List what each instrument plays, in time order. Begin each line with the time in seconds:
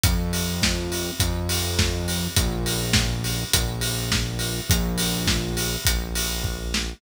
0.04 synth bass 1 F2, kick, closed hi-hat
0.33 open hi-hat
0.62 kick, snare
0.92 open hi-hat
1.20 synth bass 1 F2, kick, closed hi-hat
1.49 open hi-hat
1.79 kick, snare
2.08 open hi-hat
2.36 synth bass 1 A#1, kick, closed hi-hat
2.66 open hi-hat
2.93 kick, snare
3.24 open hi-hat
3.53 synth bass 1 A#1, kick, closed hi-hat
3.81 open hi-hat
4.12 kick, snare
4.39 open hi-hat
4.70 synth bass 1 A#1, kick, closed hi-hat
4.98 open hi-hat
5.27 kick, snare
5.57 open hi-hat
5.85 synth bass 1 A#1, kick, closed hi-hat
6.15 open hi-hat
6.44 kick
6.74 snare